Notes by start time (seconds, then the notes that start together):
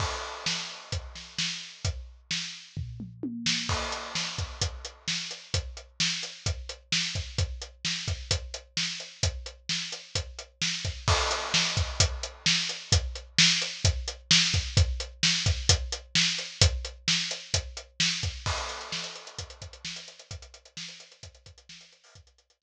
0.00 kick, crash
0.46 snare
0.92 kick, closed hi-hat
1.15 snare
1.38 snare
1.85 kick, closed hi-hat
2.31 snare
2.77 kick, floor tom
3.00 mid tom
3.23 high tom
3.46 snare
3.69 kick, crash
3.92 closed hi-hat
4.15 snare
4.38 kick, closed hi-hat
4.62 kick, closed hi-hat
4.85 closed hi-hat
5.08 snare
5.31 closed hi-hat
5.54 kick, closed hi-hat
5.77 closed hi-hat
6.00 snare
6.23 closed hi-hat
6.46 kick, closed hi-hat
6.69 closed hi-hat
6.92 snare
7.15 kick, closed hi-hat
7.38 kick, closed hi-hat
7.62 closed hi-hat
7.85 snare
8.08 kick, closed hi-hat
8.31 kick, closed hi-hat
8.54 closed hi-hat
8.77 snare
9.00 closed hi-hat
9.23 kick, closed hi-hat
9.46 closed hi-hat
9.69 snare
9.92 closed hi-hat
10.15 kick, closed hi-hat
10.39 closed hi-hat
10.62 snare
10.85 kick, closed hi-hat
11.08 kick, crash
11.31 closed hi-hat
11.54 snare
11.77 kick, closed hi-hat
12.00 kick, closed hi-hat
12.23 closed hi-hat
12.46 snare
12.69 closed hi-hat
12.92 kick, closed hi-hat
13.15 closed hi-hat
13.38 snare
13.62 closed hi-hat
13.85 kick, closed hi-hat
14.08 closed hi-hat
14.31 snare
14.54 kick, closed hi-hat
14.77 kick, closed hi-hat
15.00 closed hi-hat
15.23 snare
15.46 kick, closed hi-hat
15.69 kick, closed hi-hat
15.92 closed hi-hat
16.15 snare
16.38 closed hi-hat
16.61 kick, closed hi-hat
16.85 closed hi-hat
17.08 snare
17.31 closed hi-hat
17.54 kick, closed hi-hat
17.77 closed hi-hat
18.00 snare
18.23 kick, closed hi-hat
18.46 kick, crash
18.58 closed hi-hat
18.69 closed hi-hat
18.81 closed hi-hat
18.92 snare
19.04 closed hi-hat
19.15 closed hi-hat
19.27 closed hi-hat
19.39 kick, closed hi-hat
19.50 closed hi-hat
19.62 kick, closed hi-hat
19.73 closed hi-hat
19.85 snare
19.96 closed hi-hat
20.08 closed hi-hat
20.19 closed hi-hat
20.31 kick, closed hi-hat
20.42 closed hi-hat
20.54 closed hi-hat
20.65 closed hi-hat
20.77 snare
20.88 closed hi-hat
21.00 closed hi-hat
21.12 closed hi-hat
21.23 kick, closed hi-hat
21.35 closed hi-hat
21.46 kick, closed hi-hat
21.58 closed hi-hat
21.69 snare
21.81 closed hi-hat
21.92 closed hi-hat
22.04 open hi-hat
22.15 kick, closed hi-hat
22.27 closed hi-hat
22.38 closed hi-hat
22.50 closed hi-hat
22.62 snare